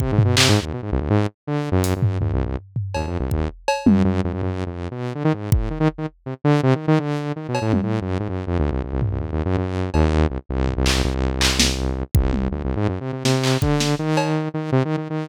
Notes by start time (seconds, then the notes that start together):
0.00 C3, kick
0.12 G#2
0.18 floor tom
0.24 B2
0.37 C3, clap
0.49 G#2
0.61 D#2
0.73 B2
0.82 G#2
0.92 C2
1.01 D2
1.10 G#2
1.47 D3
1.72 F#2
1.84 closed hi-hat
1.96 F#2
2.02 floor tom
2.21 D#2, floor tom
2.33 C2
2.45 C2
2.76 floor tom
2.94 D#2, cowbell
3.07 F2
3.20 C2
3.31 D#2, kick
3.68 cowbell
3.86 F#2, high tom
4.04 F#2
4.24 F2
4.33 F#2
4.42 F#2, floor tom
4.66 F2
4.91 B2
5.15 D3
5.24 D#3
5.33 G#2
5.52 A2, kick
5.70 D#3
5.80 D#3
5.98 D#3
6.26 C3
6.44 D3
6.63 C3
6.75 D#3
6.88 D#3
6.99 D3
7.36 D#3
7.48 B2
7.55 cowbell
7.62 A2
7.73 F#2, high tom
7.83 A2
8.01 F#2
8.20 G#2
8.29 F#2
8.47 F2
8.59 D2
8.71 C2
8.84 C2
8.93 C2
9.02 C2, floor tom
9.11 C2
9.20 D#2
9.32 D#2
9.45 F#2
9.57 F#2
9.94 D#2, cowbell
10.30 C2
10.49 C2
10.67 floor tom
10.77 C2
10.86 C2, clap
11.04 C2
11.41 clap
11.60 snare
12.15 C2, kick
12.33 high tom
12.51 D2
12.64 C2
12.76 G#2
12.88 F#2
13.01 C3
13.12 C3
13.24 C3, snare
13.44 clap
13.62 D3, kick
13.80 snare
13.99 D#3
14.17 cowbell
14.54 D#3
14.72 C3
14.85 D#3
14.97 D#3
15.10 D#3